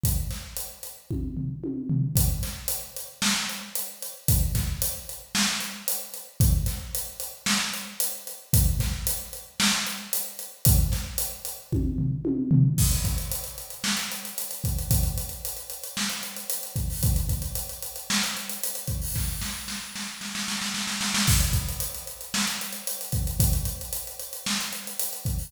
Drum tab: CC |----------------|----------------|----------------|----------------|
HH |x-x-x-x---------|x-x-x-x---x-x-x-|x-x-x-x---x-x-x-|x-x-x-x---x-x-x-|
SD |--o-------------|--o-----o-------|--o-----o-------|--o-----o-------|
T1 |--------o---o---|----------------|----------------|----------------|
FT |----------o---o-|----------------|----------------|----------------|
BD |o-------o-------|o---------------|o-o-------------|o---------------|

CC |----------------|----------------|x---------------|----------------|
HH |x-x-x-x---x-x-x-|x-x-x-x---------|-xxxxxxx-xxxxxxx|xxxxxxxx-xxxxxxo|
SD |--o-----o-------|--o-------------|--------o-------|--------o-------|
T1 |----------------|--------o---o---|----------------|----------------|
FT |----------------|----------o---o-|----------------|----------------|
BD |o-o-------------|o-------o-------|o-o-----------o-|o-------------o-|

CC |----------------|----------------|x---------------|----------------|
HH |xxxxxxxx-xxxxxxo|----------------|-xxxxxxx-xxxxxxx|xxxxxxxx-xxxxxxo|
SD |--------o-------|o-o-o-o-oooooooo|--------o-------|--------o-------|
T1 |----------------|----------------|----------------|----------------|
FT |----------------|----------------|----------------|----------------|
BD |o-o-----------o-|o---------------|o-o-----------o-|o-------------o-|